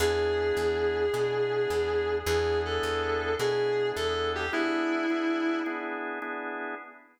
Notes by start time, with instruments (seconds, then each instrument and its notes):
0.00 electric bass (finger) E2, drawbar organ B3 D4 E4 G#4, distortion guitar G#4
0.57 electric bass (finger) E2
1.13 electric bass (finger) B2, drawbar organ B3 D4 E4 G#4
1.70 electric bass (finger) E2
2.26 electric bass (finger) E2, drawbar organ B3 D4 E4 G#4, distortion guitar G#4
2.65 distortion guitar A4
2.83 electric bass (finger) E2
3.39 electric bass (finger) B2, drawbar organ B3 D4 E4 G#4, distortion guitar G#4
3.96 electric bass (finger) E2, distortion guitar A4
4.35 distortion guitar G4
4.53 drawbar organ B3 D4 E4 G#4, distortion guitar E4
5.10 drawbar organ B3 D4 E4 G#4
5.66 drawbar organ B3 D4 E4 G#4
6.22 drawbar organ B3 D4 E4 G#4